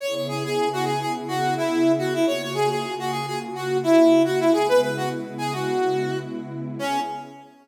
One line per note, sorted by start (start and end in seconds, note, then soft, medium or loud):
0.00 2.25 C#3 loud
0.00 2.25 B3 medium
0.00 2.25 E4 loud
0.00 2.25 G#4 medium
0.00 0.14 C#5 medium
0.15 0.27 C#5 medium
0.28 0.43 G#4 medium
0.44 0.69 G#4 medium
0.73 0.85 F#4 medium
0.85 1.00 G#4 medium
1.00 1.12 G#4 medium
1.28 1.54 F#4 medium
1.57 1.92 E4 medium
1.98 2.13 F#4 medium
2.14 2.26 E4 medium
2.25 4.50 C#3 medium
2.25 4.50 A#3 medium
2.25 4.50 F4 medium
2.25 4.50 F#4 medium
2.25 2.42 C#5 medium
2.42 2.54 C#5 medium
2.54 2.69 G#4 medium
2.70 2.94 G#4 medium
2.99 3.11 F#4 medium
3.11 3.26 G#4 medium
3.27 3.39 G#4 medium
3.55 3.78 F#4 medium
3.83 4.22 E4 medium
4.25 4.40 F#4 medium
4.40 4.52 E4 medium
4.52 6.76 C#3 loud
4.52 6.76 G#3 medium
4.52 6.76 B3 medium
4.52 6.76 E4 loud
4.52 4.67 G#4 medium
4.68 4.80 B4 loud
4.82 4.96 B4 medium
4.97 5.09 F#4 medium
5.38 5.53 G#4 medium
5.53 6.18 F#4 medium
6.79 7.00 C#3 loud
6.79 7.00 B3 loud
6.79 7.00 C#4 loud
6.79 7.00 E4 loud
6.79 7.00 G#4 loud